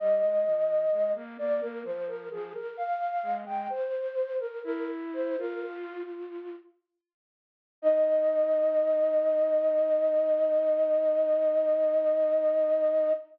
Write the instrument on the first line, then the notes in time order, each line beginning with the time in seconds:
flute
0.00 G3 D#5
0.23 G#3
0.46 F3
0.92 G#3
1.15 A#3
1.38 A#3 D5
1.61 A#3 A#4
1.84 F3 C5
2.07 A#4
2.31 F3 G#4
2.54 A#4
2.77 F5
3.23 G#3
3.46 G#3 G5
3.70 C5
4.39 A#4
4.64 E4 A#4
5.13 C5
5.38 F4 A#4
5.64 F4
7.82 D#4 D#5